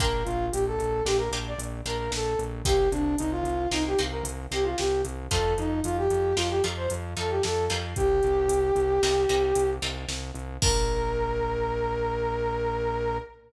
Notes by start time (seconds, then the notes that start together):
0.00 A#1 A#3 D4 F4 G4 A#4, kick, closed hi-hat
0.24 A#1 F4, closed hi-hat
0.52 A#1 G4, closed hi-hat
0.66 A4
0.79 A#1, closed hi-hat
1.05 A#1 A#3 D4 F4 G4, snare
1.17 A#4
1.31 A#1 A#3 D4 F4 G4, closed hi-hat
1.47 D5
1.58 A#1, closed hi-hat
1.86 A#1 A#3 D4 F4 G4 A#4, closed hi-hat
1.98 A#4
2.11 A#1 A4, snare
2.39 A#1, closed hi-hat
2.65 C2 A#3 C4 D#4 G4, kick, closed hi-hat
2.91 C2 D4, closed hi-hat
3.18 C2 D#4, closed hi-hat
3.31 F4
3.44 C2, closed hi-hat
3.71 C2 A#3 C4 D#4 G4, snare
3.87 G4
3.98 C2 A#3 C4 D#4 G4, closed hi-hat
4.11 A#4
4.23 C2, closed hi-hat
4.51 C2 A#3 C4 D#4 G4, closed hi-hat
4.64 F4
4.78 C2 G4, snare
5.05 C2, closed hi-hat
5.31 F2 A3 C4 D#4 F4 A4, kick, closed hi-hat
5.58 F2 D#4, closed hi-hat
5.84 F2 F4, closed hi-hat
5.97 G4
6.10 F2, closed hi-hat
6.36 F2 A3 C4 D#4 F4, snare
6.50 G4
6.64 F2 A3 C4 D#4 F4, closed hi-hat
6.77 C5
6.90 F2, closed hi-hat
7.17 F2 A3 C4 D#4 F4 A4, closed hi-hat
7.30 G4
7.43 F2 A4, snare
7.70 F2 G3 A#3 C4 D#4, closed hi-hat
7.96 C2 G4, kick, closed hi-hat
8.23 C2, closed hi-hat
8.48 C2, closed hi-hat
8.76 C2, closed hi-hat
9.02 C2 G3 A#3 C4 D#4, snare
9.29 C2 G3 A#3 C4 D#4, closed hi-hat
9.55 C2, closed hi-hat
9.82 C2 G3 A#3 C4 D#4, closed hi-hat
10.08 C2, snare
10.35 C2, closed hi-hat
10.62 A#1 A#3 D4 F4 G4 A#4, kick, crash